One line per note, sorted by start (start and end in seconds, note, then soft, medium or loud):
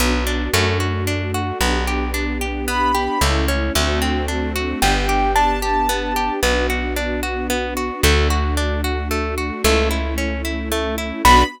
0.00 0.49 B1 medium
0.00 0.24 B3 loud
0.00 0.53 B3 medium
0.00 0.53 D4 medium
0.00 0.53 F#4 medium
0.27 0.51 D4 loud
0.53 1.52 F#2 loud
0.53 0.78 A3 loud
0.53 1.60 A3 medium
0.53 1.60 D4 medium
0.53 1.60 F#4 medium
0.80 1.04 F#4 medium
1.07 1.31 D4 medium
1.34 1.58 F#4 medium
1.61 3.08 B1 loud
1.61 1.85 B3 medium
1.61 3.20 B3 medium
1.61 3.20 D4 medium
1.61 3.20 G4 medium
1.87 2.11 G4 medium
2.14 2.38 D4 medium
2.41 2.65 G4 medium
2.68 2.92 B3 loud
2.68 3.21 B5 medium
2.95 3.19 G4 loud
3.21 3.71 C#2 loud
3.21 3.74 A3 medium
3.21 3.46 A3 loud
3.21 3.74 C#4 medium
3.21 3.74 E4 medium
3.48 3.72 C#4 medium
3.75 4.74 D2 loud
3.75 3.99 A3 loud
3.75 4.81 A3 medium
3.75 4.81 C4 medium
3.75 4.81 D4 medium
3.75 4.81 F#4 medium
4.02 4.26 C4 medium
4.28 4.52 D4 medium
4.56 4.80 F#4 loud
4.81 6.30 G1 loud
4.81 6.40 B3 medium
4.81 5.06 B3 loud
4.81 6.40 D4 medium
4.81 6.40 G4 medium
4.81 5.31 G5 medium
5.09 5.33 G4 medium
5.35 5.60 D4 medium
5.35 6.33 A5 medium
5.62 5.86 G4 medium
5.89 6.13 B3 loud
6.16 6.40 G4 medium
6.43 7.91 B1 medium
6.43 6.67 B3 loud
6.43 8.02 B3 medium
6.43 8.02 D4 medium
6.43 8.02 F#4 medium
6.70 6.94 F#4 medium
6.96 7.21 D4 loud
7.23 7.47 F#4 medium
7.50 7.74 B3 loud
7.77 8.01 F#4 medium
8.03 9.51 D2 loud
8.03 8.28 A3 loud
8.03 9.63 A3 medium
8.03 9.63 D4 medium
8.03 9.63 F#4 medium
8.30 8.54 F#4 medium
8.57 8.81 D4 loud
8.84 9.08 F#4 medium
9.11 9.35 A3 medium
9.38 9.62 F#4 medium
9.64 11.12 C#2 loud
9.64 11.23 A3 medium
9.64 9.89 A3 loud
9.64 11.23 C#4 medium
9.64 11.23 E4 medium
9.91 10.15 E4 medium
10.18 10.42 C#4 medium
10.45 10.69 E4 medium
10.72 10.96 A3 loud
10.98 11.22 E4 medium
11.25 11.44 B1 loud
11.25 11.43 B3 loud
11.25 11.44 B3 medium
11.25 11.43 D4 medium
11.25 11.44 D4 loud
11.25 11.43 F#4 loud
11.25 11.44 F#4 loud
11.25 11.44 B5 loud